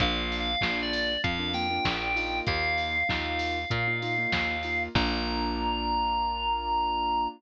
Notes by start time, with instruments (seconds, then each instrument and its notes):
0.00 electric bass (finger) A#1, acoustic grand piano A#3 D4 F4, electric piano 2 F5, kick, closed hi-hat
0.32 open hi-hat
0.40 electric piano 2 F5
0.61 electric bass (finger) A#1, acoustic grand piano A#3 D4 F4, kick, snare
0.83 electric piano 2 D5
0.93 open hi-hat
1.24 electric bass (finger) F2, electric piano 2 F5, kick, closed hi-hat
1.39 acoustic grand piano A#3 D4 F4
1.54 acoustic grand piano A#3 D4 F4, electric piano 2 G5, open hi-hat
1.70 acoustic grand piano A#3 D4 F4
1.85 electric bass (finger) A#1, kick, snare
2.16 acoustic grand piano A#3 D#4 F4, open hi-hat
2.47 electric bass (finger) D#2, electric piano 2 F5, kick, closed hi-hat
2.78 open hi-hat
3.09 electric bass (finger) D#2, acoustic grand piano A#3 D#4 F4, kick, snare
3.39 open hi-hat
3.70 electric bass (finger) A#2, kick, closed hi-hat
3.88 acoustic grand piano A#3 D#4 F4
4.02 acoustic grand piano A#3 D#4 F4, open hi-hat
4.18 acoustic grand piano A#3 D#4 F4
4.32 electric bass (finger) D#2, kick, snare
4.63 acoustic grand piano A#3 D#4 F4, open hi-hat
4.95 electric bass (finger) A#1, acoustic grand piano A#3 D4 F4, electric piano 2 A#5, kick, crash